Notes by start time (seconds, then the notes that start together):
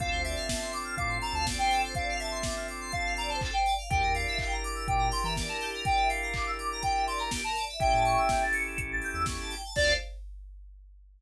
0.00 D2 C4 D4 F4 A4 F5, kick, closed hi-hat
0.11 D2 C5
0.24 D5 E5, open hi-hat
0.35 F5
0.49 A5, kick, snare
0.61 C6
0.72 D6, open hi-hat
0.84 F6
0.97 A2 F5 D6, kick, closed hi-hat
1.09 C6
1.22 A5 A#5, open hi-hat
1.33 D2 F5 A5
1.46 D5, kick, snare
1.58 C5 G5
1.71 A4, open hi-hat
1.84 C5
1.95 D5 F5, kick, closed hi-hat
2.09 F5
2.19 E5 A5, open hi-hat
2.31 C6
2.43 D6, kick, snare
2.56 F6
2.68 D6, open hi-hat
2.81 C6
2.92 F5 A5, kick, closed hi-hat
3.05 F5
3.17 D5 A#5, open hi-hat
3.29 C5 A5
3.41 A4, kick, clap
3.52 C5 G5
3.66 D5, open hi-hat
3.78 F5
3.90 E2 D4 E4 G4 A#4 G5, kick, closed hi-hat
4.02 E2 A#4
4.14 D5 F5, open hi-hat
4.27 E5
4.39 G5, kick, clap
4.51 A#5
4.64 D6, open hi-hat
4.75 E6
4.88 A#2 G5 D6, kick, closed hi-hat
4.99 A#5
5.10 G5 C6, open hi-hat
5.23 E3 E5 A#5
5.35 D5, kick, snare
5.48 A#4 A5
5.60 G4, open hi-hat
5.74 A#4
5.85 D5 G5, kick, closed hi-hat
5.97 E5
6.08 F5 G5, open hi-hat
6.22 A#5
6.34 D6, kick, clap
6.46 E6
6.58 D6, open hi-hat
6.72 A#5
6.82 G5, kick, closed hi-hat
6.95 E5
7.07 D5 C6, open hi-hat
7.18 A#4 A#5
7.31 G4, kick, snare
7.44 A#4 A5
7.55 D5, open hi-hat
7.68 E5
7.80 A1 C#4 E4 G4 A4 E5 G5, kick, closed hi-hat
7.93 A2 A5
8.05 C#6, open hi-hat
8.17 E6
8.29 G6, kick, snare
8.42 A6
8.53 C#7, open hi-hat
8.67 E7
8.77 A1 C#7, kick, closed hi-hat
8.91 A6
9.02 G6, open hi-hat
9.14 E2 E6
9.25 C#6, kick, snare
9.39 A5
9.51 G5, open hi-hat
9.64 A5
9.76 D2 C4 D4 F4 A4 C5 D5 F5, kick, crash